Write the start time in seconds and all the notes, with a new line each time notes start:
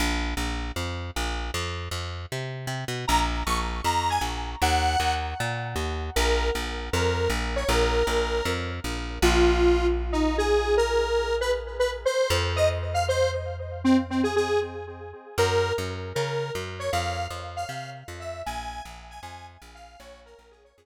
0.00 A#1
0.37 A#1
0.76 F2
1.16 A#1
1.54 F2
1.91 F2
2.32 C3
2.67 C3
2.88 B2
3.08 A#1 A#5
3.46 A#1 C#6
3.84 F2 A#5
4.10 G#5
4.21 A#1
4.62 D#2 F#5
5.00 D#2
5.40 A#2
5.76 D#2
6.16 A#1 A#4
6.55 A#1
6.93 F2 A#4
7.30 A#1
7.56 C#5
7.69 A#1 A#4
8.07 A#1
8.45 F2
8.84 A#1
9.22 A#1 F4
10.12 D#4
10.38 G#4
10.77 A#4
11.41 B4
11.79 B4
12.05 C5
12.30 F2
12.56 D#5
12.94 F5
13.08 C5
13.84 C4
14.10 C4
14.23 G#4
14.36 G#4
15.38 F#2 A#4
15.78 F#2
16.15 C#3 A#4
16.55 F#2
16.79 C#5
16.92 F2 F5
17.30 F2
17.56 F5
17.68 C3 F5
18.08 F2
18.20 E5
18.46 A#1 G#5
18.85 A#1
19.10 G#5
19.23 F2 G#5
19.62 A#1
19.75 F5
20.00 A#1 C#5
20.26 A#4
20.39 A#1
20.51 G#4
20.64 C#5
20.77 F2 G#4